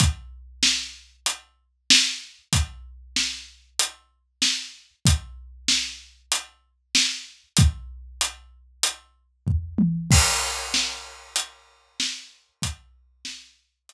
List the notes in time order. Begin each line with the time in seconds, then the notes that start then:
0.00 kick, closed hi-hat
0.63 snare
1.26 closed hi-hat
1.90 snare
2.53 kick, closed hi-hat
3.16 snare
3.79 closed hi-hat
4.42 snare
5.05 kick, closed hi-hat
5.68 snare
6.32 closed hi-hat
6.95 snare
7.57 kick, closed hi-hat
8.21 closed hi-hat
8.83 closed hi-hat
9.47 kick, floor tom
9.78 high tom
10.11 kick, crash
10.74 snare
11.36 closed hi-hat
12.00 snare
12.62 kick, closed hi-hat
13.25 snare
13.89 closed hi-hat